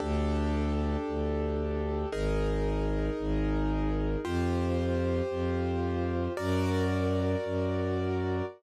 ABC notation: X:1
M:4/4
L:1/8
Q:1/4=113
K:Gm
V:1 name="Acoustic Grand Piano"
[DGA]8 | [E_AB]8 | [FGc]8 | [^F^Ad]8 |]
V:2 name="Violin" clef=bass
D,,4 D,,4 | _A,,,4 A,,,4 | F,,4 F,,4 | ^F,,4 F,,4 |]